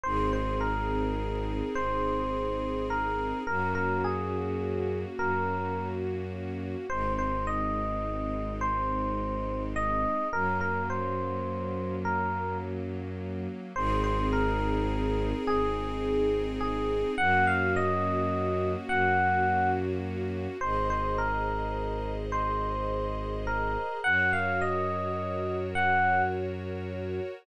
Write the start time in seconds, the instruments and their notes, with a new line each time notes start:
0.03 violin G#1, string ensemble 1 C4 D#4 G#4, electric piano 1 C5
0.33 electric piano 1 C5
0.61 electric piano 1 A#4
1.75 violin G#1, electric piano 1 C5
2.90 electric piano 1 A#4
3.47 violin F#2, string ensemble 1 A#3 C#4 F#4, electric piano 1 A#4
3.75 electric piano 1 A#4
4.04 electric piano 1 G#4
5.18 violin F#2, electric piano 1 A#4
6.90 violin G#1, string ensemble 1 G#3 C4 D#4, electric piano 1 C5
7.18 electric piano 1 C5
7.47 electric piano 1 D#5
8.61 electric piano 1 C5
9.76 electric piano 1 D#5
10.33 violin F#2, string ensemble 1 F#3 A#3 C#4, electric piano 1 A#4
10.61 electric piano 1 A#4
10.90 electric piano 1 C5
12.05 electric piano 1 A#4
13.76 violin G#1, string ensemble 1 C4 D#4 G#4, electric piano 1 C5
14.04 electric piano 1 C5
14.33 electric piano 1 A#4
15.46 violin G#1, electric piano 1 G#4
16.61 electric piano 1 G#4
17.18 violin F#2, string ensemble 1 A#3 C#4 F#4, electric piano 1 F#5
17.47 electric piano 1 F5
17.76 electric piano 1 D#5
18.89 violin F#2, electric piano 1 F#5
20.61 violin G#1, string ensemble 1 G#4 C5 D#5, electric piano 1 C5
20.90 electric piano 1 C5
21.18 electric piano 1 A#4
22.32 electric piano 1 C5
23.47 electric piano 1 A#4
24.04 violin F#2, string ensemble 1 F#4 A#4 C#5, electric piano 1 F#5
24.33 electric piano 1 F5
24.61 electric piano 1 D#5
25.75 electric piano 1 F#5